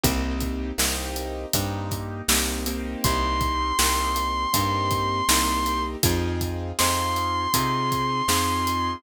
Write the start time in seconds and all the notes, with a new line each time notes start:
0.04 C2 A#3 C4 D#4 G4, kick, closed hi-hat
0.40 kick, closed hi-hat
0.78 C2 A#3 C4 D#4 G4, snare
1.16 closed hi-hat
1.53 G2 A#3 C4 D#4 G4, kick, closed hi-hat
1.91 kick, closed hi-hat
2.28 C2 A#3 C4 D#4 G4, snare
2.66 A#3 C4 D#4 G4, closed hi-hat
3.04 C2 C6, kick, closed hi-hat
3.41 kick, closed hi-hat
3.79 C2 A#3 C4 D#4 G4, snare
4.16 closed hi-hat
4.53 G2 A#3 C4 D#4 G4, kick, closed hi-hat
4.91 kick, closed hi-hat
5.29 C2 A#3 C4 D#4 G4, snare
5.66 closed hi-hat
6.03 F2 C4 D#4 F4 G#4, kick, closed hi-hat
6.41 kick, closed hi-hat
6.79 F2 C4 D#4 F4 G#4 C6, snare
7.16 closed hi-hat
7.54 C3 C4 D#4 F4 G#4, kick, closed hi-hat
7.92 kick, closed hi-hat
8.28 F2 C4 D#4 F4 G#4, snare
8.67 closed hi-hat